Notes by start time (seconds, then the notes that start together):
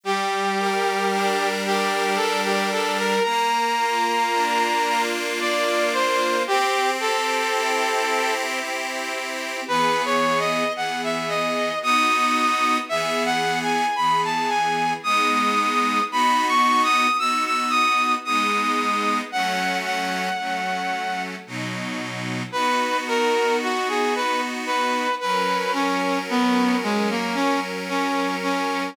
0.04 G3 G4
0.58 A#4
1.12 D4
1.64 G4 A#4
2.16 G3 A4
2.45 G4
2.72 A4 A#4
2.98 A#4
3.23 A#3 A#5
3.78 F4
4.32 D4
4.86 F4
5.40 A#3 D5
5.93 F4 C5
6.47 C4 G4
7.00 G4 A4
7.53 E4
8.08 G4
8.60 C4
9.13 G4
9.68 E3 B3 G#4 B4
10.05 C#5
10.39 D#5
10.76 E3 B3 G#4 F#5
11.04 E5
11.29 D#5
11.82 B3 D#4 F#4 D#6
12.89 E3 B3 G#4 E5
13.25 F#5
13.62 G#5
13.96 E3 B3 G#4 B5
14.24 A5
14.49 G#5
15.03 G#3 B3 D#4 D#6
16.11 B3 D#4 F#4 B5
16.48 C#6
16.83 D#6
17.19 B3 D#4 F#4 E6
17.46 E6
17.70 D#6
18.25 G#3 B3 D#4 D#6
19.32 F#3 A3 C#4 F#5
19.85 F#5
20.39 F#3 A3 C#4
21.47 B2 F#3 D#4
22.52 B3 D#4 F#4 B4
23.08 A#4
23.63 F#4
23.89 G#4
24.16 B4
24.66 B4
25.20 F#3 C#4 A#4 B4
25.73 C#4
26.29 B3
26.83 G#3
27.10 A#3
27.35 C#4
27.89 C#4
28.43 C#4